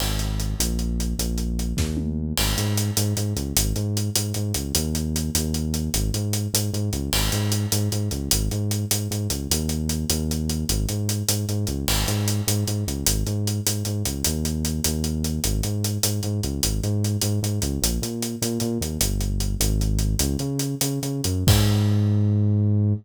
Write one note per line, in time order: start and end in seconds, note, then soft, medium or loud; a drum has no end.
0.00 0.55 G#1 medium
0.00 crash medium
0.19 closed hi-hat medium
0.40 closed hi-hat medium
0.59 1.14 A#1 medium
0.59 closed hi-hat loud
0.79 closed hi-hat medium
1.00 closed hi-hat medium
1.19 1.73 A#1 medium
1.19 closed hi-hat medium
1.38 closed hi-hat medium
1.59 closed hi-hat medium
1.77 2.33 D#2 medium
1.77 kick medium
1.77 snare medium
1.97 high tom medium
2.37 2.55 G#1 medium
2.37 crash loud
2.57 2.91 G#2 medium
2.57 closed hi-hat medium
2.77 closed hi-hat medium
2.97 3.14 G#2 medium
2.97 closed hi-hat loud
3.17 3.34 G#2 medium
3.17 closed hi-hat medium
3.36 3.53 C#2 medium
3.36 closed hi-hat medium
3.57 3.73 G#1 medium
3.57 closed hi-hat loud
3.76 4.10 G#2 medium
3.76 closed hi-hat medium
3.97 closed hi-hat medium
4.15 4.33 G#2 medium
4.15 closed hi-hat loud
4.34 4.53 G#2 medium
4.34 closed hi-hat medium
4.54 4.72 C#2 medium
4.54 closed hi-hat medium
4.75 5.30 D#2 medium
4.75 closed hi-hat loud
4.95 closed hi-hat medium
5.16 closed hi-hat medium
5.35 5.89 D#2 medium
5.35 closed hi-hat loud
5.54 closed hi-hat medium
5.74 closed hi-hat medium
5.94 6.11 G#1 medium
5.94 closed hi-hat loud
6.14 6.48 G#2 medium
6.14 closed hi-hat medium
6.33 closed hi-hat medium
6.53 6.70 G#2 medium
6.53 closed hi-hat loud
6.73 6.90 G#2 medium
6.73 closed hi-hat medium
6.93 7.10 C#2 medium
6.93 closed hi-hat medium
7.13 7.29 G#1 medium
7.13 crash loud
7.32 7.66 G#2 medium
7.32 closed hi-hat medium
7.52 closed hi-hat medium
7.72 7.89 G#2 medium
7.72 closed hi-hat loud
7.92 8.09 G#2 medium
7.92 closed hi-hat medium
8.11 8.29 C#2 medium
8.11 closed hi-hat medium
8.31 8.49 G#1 medium
8.31 closed hi-hat loud
8.51 8.85 G#2 medium
8.51 closed hi-hat medium
8.71 closed hi-hat medium
8.91 9.08 G#2 medium
8.91 closed hi-hat loud
9.11 9.28 G#2 medium
9.11 closed hi-hat medium
9.30 9.48 C#2 medium
9.30 closed hi-hat medium
9.51 10.05 D#2 medium
9.51 closed hi-hat loud
9.69 closed hi-hat medium
9.89 closed hi-hat medium
10.10 10.65 D#2 medium
10.10 closed hi-hat loud
10.31 closed hi-hat medium
10.49 closed hi-hat medium
10.69 10.86 G#1 medium
10.69 closed hi-hat loud
10.89 11.23 G#2 medium
10.89 closed hi-hat medium
11.09 closed hi-hat medium
11.29 11.45 G#2 medium
11.29 closed hi-hat loud
11.49 11.66 G#2 medium
11.49 closed hi-hat medium
11.67 11.85 C#2 medium
11.67 closed hi-hat medium
11.88 12.05 G#1 medium
11.88 crash loud
12.08 12.41 G#2 medium
12.08 closed hi-hat medium
12.28 closed hi-hat medium
12.47 12.64 G#2 medium
12.47 closed hi-hat loud
12.67 12.84 G#2 medium
12.67 closed hi-hat medium
12.87 13.04 C#2 medium
12.87 closed hi-hat medium
13.06 13.24 G#1 medium
13.06 closed hi-hat loud
13.26 13.60 G#2 medium
13.26 closed hi-hat medium
13.47 closed hi-hat medium
13.66 13.83 G#2 medium
13.66 closed hi-hat loud
13.85 14.03 G#2 medium
13.85 closed hi-hat medium
14.05 14.23 C#2 medium
14.05 closed hi-hat medium
14.24 14.81 D#2 medium
14.24 closed hi-hat loud
14.45 closed hi-hat medium
14.65 closed hi-hat medium
14.84 15.40 D#2 medium
14.84 closed hi-hat loud
15.04 closed hi-hat medium
15.24 closed hi-hat medium
15.44 15.61 G#1 medium
15.44 closed hi-hat loud
15.63 15.98 G#2 medium
15.63 closed hi-hat medium
15.84 closed hi-hat medium
16.03 16.21 G#2 medium
16.03 closed hi-hat loud
16.23 16.41 G#2 medium
16.23 closed hi-hat medium
16.43 16.60 C#2 medium
16.43 closed hi-hat medium
16.63 16.80 G#1 medium
16.63 closed hi-hat loud
16.83 17.17 G#2 medium
16.83 closed hi-hat medium
17.04 closed hi-hat medium
17.21 17.40 G#2 medium
17.21 closed hi-hat loud
17.43 17.59 G#2 medium
17.43 closed hi-hat medium
17.62 17.79 C#2 medium
17.62 closed hi-hat medium
17.82 17.99 A#1 medium
17.82 closed hi-hat loud
18.02 18.36 A#2 medium
18.02 closed hi-hat medium
18.22 closed hi-hat medium
18.42 18.59 A#2 medium
18.42 closed hi-hat medium
18.60 18.78 A#2 medium
18.60 closed hi-hat medium
18.81 18.98 D#2 medium
18.81 closed hi-hat medium
19.01 19.56 G1 medium
19.01 closed hi-hat loud
19.21 closed hi-hat medium
19.40 closed hi-hat medium
19.60 20.15 G#1 loud
19.60 closed hi-hat loud
19.81 closed hi-hat medium
19.99 closed hi-hat medium
20.19 20.37 C#2 loud
20.19 closed hi-hat loud
20.39 20.75 C#3 medium
20.39 closed hi-hat medium
20.59 closed hi-hat medium
20.81 20.99 C#3 medium
20.81 closed hi-hat loud
21.03 21.21 C#3 medium
21.03 closed hi-hat medium
21.24 21.44 F#2 medium
21.24 closed hi-hat medium
21.47 22.93 G#2 loud
21.47 kick loud
21.47 crash loud